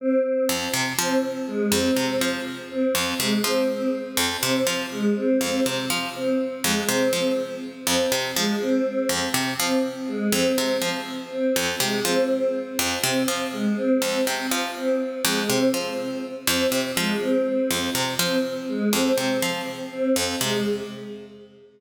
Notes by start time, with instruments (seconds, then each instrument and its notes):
0.00 choir aahs C4
0.24 choir aahs C4
0.49 harpsichord F2
0.74 harpsichord C3
0.99 harpsichord F3, choir aahs C4
1.47 choir aahs G#3
1.72 harpsichord F2, choir aahs C4
1.96 harpsichord C3, choir aahs C4
2.21 harpsichord F3
2.71 choir aahs C4
2.95 harpsichord F2
3.19 harpsichord C3, choir aahs G#3
3.44 harpsichord F3, choir aahs C4
3.69 choir aahs C4
4.17 harpsichord F2
4.42 harpsichord C3, choir aahs C4
4.67 harpsichord F3
4.92 choir aahs G#3
5.16 choir aahs C4
5.41 harpsichord F2, choir aahs C4
5.66 harpsichord C3
5.90 harpsichord F3
6.15 choir aahs C4
6.64 harpsichord F2, choir aahs G#3
6.89 harpsichord C3, choir aahs C4
7.13 harpsichord F3, choir aahs C4
7.86 harpsichord F2, choir aahs C4
8.12 harpsichord C3
8.36 harpsichord F3, choir aahs G#3
8.61 choir aahs C4
8.86 choir aahs C4
9.09 harpsichord F2
9.34 harpsichord C3
9.59 harpsichord F3, choir aahs C4
10.08 choir aahs G#3
10.32 harpsichord F2, choir aahs C4
10.58 harpsichord C3, choir aahs C4
10.82 harpsichord F3
11.31 choir aahs C4
11.56 harpsichord F2
11.80 harpsichord C3, choir aahs G#3
12.05 harpsichord F3, choir aahs C4
12.30 choir aahs C4
12.79 harpsichord F2
13.03 harpsichord C3, choir aahs C4
13.28 harpsichord F3
13.52 choir aahs G#3
13.77 choir aahs C4
14.02 harpsichord F2, choir aahs C4
14.27 harpsichord C3
14.51 harpsichord F3
14.76 choir aahs C4
15.25 harpsichord F2, choir aahs G#3
15.49 harpsichord C3, choir aahs C4
15.73 harpsichord F3, choir aahs C4
16.47 harpsichord F2, choir aahs C4
16.72 harpsichord C3
16.97 harpsichord F3, choir aahs G#3
17.22 choir aahs C4
17.46 choir aahs C4
17.71 harpsichord F2
17.95 harpsichord C3
18.19 harpsichord F3, choir aahs C4
18.69 choir aahs G#3
18.93 harpsichord F2, choir aahs C4
19.18 harpsichord C3, choir aahs C4
19.42 harpsichord F3
19.92 choir aahs C4
20.16 harpsichord F2
20.41 harpsichord C3, choir aahs G#3